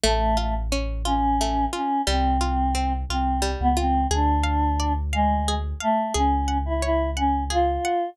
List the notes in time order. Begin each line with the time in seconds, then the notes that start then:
0.04 A1 A3
0.37 A3 F4
0.72 C#4
1.05 C#4 F4
1.41 A3
1.73 C#4 F4
2.07 C2 G3 C4
2.41 F4
2.75 C4
3.09 C2 C4 F4
3.42 G3
3.60 C#2 B3
3.77 C4 F4
4.11 D2 D4 G#4
4.44 F5
4.80 D5
5.13 G#3 F5
5.48 G#4
5.80 A3 F5
6.14 C#2 C#4 G#4
6.48 F#5
6.66 E4
6.82 E4 C#5
7.16 C#4 F#5
7.50 F4 G#4
7.85 F#5